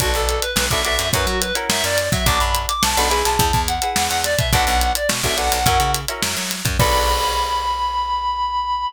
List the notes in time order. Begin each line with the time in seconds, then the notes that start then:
0.00 B1 D4 F#4 A4 B4, kick, closed hi-hat
0.14 B1 A4, closed hi-hat
0.29 closed hi-hat
0.42 B4, closed hi-hat
0.56 B1, snare
0.70 B1 D4 F#4 A4 B4 E5, kick, closed hi-hat
0.84 D4 F#4 A4 B4 E5, closed hi-hat
0.99 F#2, closed hi-hat
1.13 F#2 C#4 E4 F#4 A#4 B4, kick, closed hi-hat
1.26 F#3 F#4, closed hi-hat
1.41 B4, closed hi-hat
1.55 C#4 E4 F#4 A#4, closed hi-hat
1.69 F#2 E5, snare
1.84 F#2 D5, closed hi-hat
1.98 closed hi-hat
2.12 F#3 E5, kick, open hi-hat
2.26 B1 D4 F#4 A4 B4 D6, kick, closed hi-hat
2.39 F#2 B5, closed hi-hat
2.55 closed hi-hat
2.68 D6, closed hi-hat
2.83 B1 A5, snare
2.97 B1 D4 F#4 A4 B4 B5, closed hi-hat
3.10 E4 G#4 B4, closed hi-hat
3.25 B1 A5, closed hi-hat
3.39 E2, kick, closed hi-hat
3.53 E2, kick, closed hi-hat
3.68 F#5, closed hi-hat
3.82 E4 G#4 B4, closed hi-hat
3.96 E2, snare
4.09 E2 F#5, closed hi-hat
4.24 D5, snare, closed hi-hat
4.38 B2 E5, kick, closed hi-hat
4.52 B1 D4 F#4 A4 B4 F#5, kick, closed hi-hat
4.67 B1, closed hi-hat
4.81 closed hi-hat
4.95 D5, closed hi-hat
5.09 B2, snare
5.23 B1 D4 F#4 A4 B4 E5, kick, snare, closed hi-hat
5.37 D4 F#4 A4 B4 F#5, closed hi-hat
5.52 B1, closed hi-hat
5.66 F#2 C#4 E4 F#4 A#4, kick, closed hi-hat
5.80 C#3, closed hi-hat
5.94 closed hi-hat
6.08 C#4 E4 F#4 A#4, closed hi-hat
6.23 F#2, snare
6.37 F#3, closed hi-hat
6.50 snare, closed hi-hat
6.65 F#2, kick, closed hi-hat
6.79 B1 D4 F#4 A4 B4 B5, kick, crash